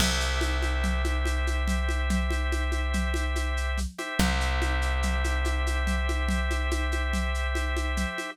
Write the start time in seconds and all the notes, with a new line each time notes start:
0.00 C2 G4 C5 E5, crash, low conga, shaker
0.20 shaker
0.41 high conga, shaker
0.62 high conga, shaker
0.84 low conga, shaker
1.04 high conga, shaker
1.25 high conga, shaker
1.47 high conga, shaker
1.68 low conga, shaker
1.89 high conga, shaker
2.10 low conga, shaker
2.31 high conga, shaker
2.52 high conga, shaker
2.72 high conga, shaker
2.94 low conga, shaker
3.14 high conga, shaker
3.36 high conga, shaker
3.57 shaker
3.78 low conga, shaker
3.98 G4 C5 E5, high conga, shaker
4.19 C2, low conga, shaker
4.41 shaker
4.62 high conga, shaker
4.82 shaker
5.03 low conga, shaker
5.24 high conga, shaker
5.45 high conga, shaker
5.67 high conga, shaker
5.87 low conga, shaker
6.09 high conga, shaker
6.28 low conga, shaker
6.50 high conga, shaker
6.71 high conga, shaker
6.92 high conga, shaker
7.13 low conga, shaker
7.34 shaker
7.55 high conga, shaker
7.77 high conga, shaker
7.97 low conga, shaker
8.18 high conga, shaker